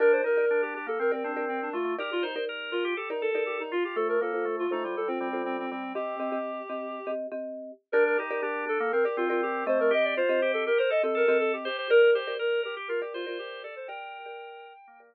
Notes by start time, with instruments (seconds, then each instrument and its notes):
0.00 drawbar organ D4, marimba G4 A#4 D5, clarinet A#4
0.12 clarinet C5
0.24 drawbar organ D#4, clarinet A#4
0.37 marimba G4 A#4 D5
0.51 drawbar organ D4
0.62 clarinet G4
0.74 drawbar organ D4, clarinet G4
0.86 drawbar organ A#3, clarinet A4
0.99 drawbar organ C4, clarinet A#4
1.12 clarinet C4, marimba G4 A#4 D5
1.24 drawbar organ C4, clarinet D4
1.36 marimba G4 A#4 D5
1.48 clarinet C4
1.62 clarinet D4
1.73 drawbar organ A3, clarinet F4
1.85 drawbar organ A3
1.99 marimba D#4 G4 A#4 D5, clarinet G4, drawbar organ A#4
2.12 clarinet F4
2.23 clarinet D#4, drawbar organ C5
2.36 marimba D#4 G4 A#4 D5
2.49 drawbar organ A#4
2.71 clarinet F4, drawbar organ A#4
2.85 drawbar organ G4
2.97 clarinet G4, drawbar organ A4
3.10 marimba D#4 G4 A#4 D5, clarinet D#4
3.22 clarinet A4, drawbar organ A4
3.35 marimba D#4 G4 A#4 D5
3.46 clarinet G4
3.60 clarinet D#4
3.72 drawbar organ F4, clarinet F4
3.84 drawbar organ F4, clarinet G4
3.96 drawbar organ A3, marimba F4 A4 C5, clarinet A4
4.09 clarinet A#4
4.21 drawbar organ A#3, marimba F4 A4 C5, clarinet A4
4.34 marimba F4 A4 C5
4.45 drawbar organ A3
4.59 clarinet F4
4.71 drawbar organ A3, clarinet D#4, marimba F4 A4 C5
4.84 drawbar organ G3, clarinet F4
4.96 drawbar organ G3, clarinet A4
5.08 clarinet C4, marimba F4 A4 C5
5.19 drawbar organ G3, clarinet C4
5.33 marimba F4 A4 C5
5.45 clarinet C4
5.59 clarinet C4
5.70 drawbar organ G3, clarinet C4
5.83 drawbar organ G3
5.95 marimba C4 G4 D#5, drawbar organ C4, clarinet G4
6.20 marimba C4 G4 D#5
6.32 marimba C4 G4 D#5
6.70 marimba C4 G4 D#5
7.07 marimba C4 G4 D#5
7.32 marimba C4 G4 D#5
7.92 drawbar organ D4, marimba G4 A#4 D5, clarinet A#4
8.06 clarinet A#4
8.17 drawbar organ D#4, clarinet G4
8.31 marimba G4 A#4 D5
8.42 drawbar organ D4, clarinet G4
8.67 drawbar organ D4, clarinet A4
8.80 drawbar organ A#3
8.92 drawbar organ C4, clarinet A#4
9.05 clarinet G4, marimba G4 A#4 D5
9.17 drawbar organ C4, clarinet F4
9.29 clarinet F4, marimba G4 A#4 D5
9.43 clarinet G4
9.66 drawbar organ A3, marimba C4 G4 D#5, clarinet C5
9.79 drawbar organ A3, clarinet A#4
9.91 drawbar organ G4, clarinet D#5
10.04 clarinet D5
10.17 drawbar organ F4, clarinet C5
10.29 marimba C4 G4 D#5
10.42 drawbar organ G4
10.53 clarinet A4
10.66 drawbar organ G4, clarinet A#4
10.78 drawbar organ A#4, clarinet C5
10.90 drawbar organ A4, clarinet D#5
11.03 marimba C4 G4 D#5, clarinet A4
11.15 drawbar organ A4, clarinet A#4
11.28 marimba C4 G4 D#5
11.40 clarinet A4
11.53 clarinet G4
11.65 clarinet G4, drawbar organ C5
11.79 drawbar organ C5
11.90 marimba G4 A#4 D5, clarinet A#4, drawbar organ A#4
12.02 clarinet A#4
12.14 clarinet G4, drawbar organ C5
12.27 marimba G4 A#4 D5
12.39 drawbar organ A#4, clarinet A#4
12.63 clarinet G4, drawbar organ A#4
12.77 drawbar organ G4
12.88 drawbar organ F4, clarinet A#4
13.02 clarinet G4, marimba G4 A#4 D5
13.14 clarinet F4, drawbar organ C5
13.26 clarinet F4, marimba G4 A#4 D5
13.39 clarinet G4
13.63 drawbar organ A4, clarinet D5
13.76 drawbar organ A4, clarinet C5
13.88 marimba G4 A#4 D5, drawbar organ A#4, clarinet G5
14.26 marimba G4 A#4 D5
14.88 drawbar organ A#3
15.00 marimba G4 A#4 D5